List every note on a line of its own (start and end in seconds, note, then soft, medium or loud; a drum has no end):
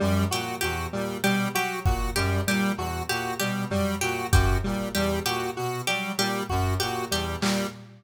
0.00 0.25 F#2 medium
0.00 0.25 G3 medium
0.00 high tom medium
0.31 0.56 A#2 medium
0.31 0.56 F#4 medium
0.31 0.57 G4 medium
0.61 0.87 E2 medium
0.61 0.87 F#4 medium
0.61 0.86 G4 medium
0.93 1.17 A#2 medium
0.93 1.18 G3 medium
1.24 1.48 B2 medium
1.24 1.48 G3 medium
1.24 1.48 G4 medium
1.55 1.80 F#3 medium
1.55 1.79 F#4 medium
1.55 1.80 G4 medium
1.85 2.10 A#2 medium
1.85 2.10 F#4 medium
1.85 kick loud
2.15 2.40 F#2 medium
2.15 2.41 G3 medium
2.15 2.41 G4 medium
2.47 2.72 A#2 medium
2.47 2.72 G3 medium
2.47 2.73 G4 medium
2.77 3.02 E2 medium
2.77 3.03 F#4 medium
2.77 cowbell medium
3.09 3.34 A#2 medium
3.09 3.34 F#4 medium
3.09 3.34 G4 medium
3.40 3.66 B2 medium
3.40 3.65 G3 medium
3.40 3.64 G4 medium
3.70 3.95 F#3 medium
3.70 3.96 G3 medium
3.70 floor tom medium
4.01 4.26 A#2 medium
4.01 4.27 F#4 medium
4.01 4.26 G4 medium
4.32 4.57 F#2 medium
4.32 4.58 F#4 medium
4.32 4.58 G4 medium
4.32 kick loud
4.64 4.89 A#2 medium
4.64 4.89 G3 medium
4.95 5.20 E2 medium
4.95 5.20 G3 medium
4.95 5.19 G4 medium
5.25 5.50 A#2 medium
5.25 5.51 F#4 medium
5.25 5.50 G4 medium
5.57 5.82 B2 medium
5.57 5.81 F#4 medium
5.87 6.13 F#3 medium
5.87 6.12 G3 medium
5.87 6.12 G4 medium
6.17 6.42 A#2 medium
6.17 6.43 G3 medium
6.17 6.44 G4 medium
6.49 6.75 F#2 medium
6.49 6.74 F#4 medium
6.49 kick medium
6.80 7.06 A#2 medium
6.80 7.05 F#4 medium
6.80 7.05 G4 medium
7.11 7.36 E2 medium
7.11 7.36 G3 medium
7.11 7.37 G4 medium
7.41 7.65 A#2 medium
7.41 7.67 G3 medium
7.41 clap loud